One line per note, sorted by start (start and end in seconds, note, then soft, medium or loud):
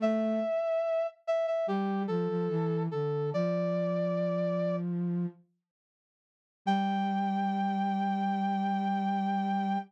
0.00 0.40 A3 loud
0.00 1.07 E5 medium
1.27 1.46 E5 medium
1.47 1.66 E5 medium
1.67 2.06 G3 medium
1.67 2.03 G4 medium
2.08 2.28 F3 medium
2.08 2.83 A4 medium
2.29 2.48 F3 medium
2.49 2.88 E3 medium
2.91 3.32 D3 medium
2.91 3.30 A4 medium
3.33 5.26 F3 medium
3.33 4.76 D5 medium
6.66 9.77 G3 loud
6.66 9.78 G5 loud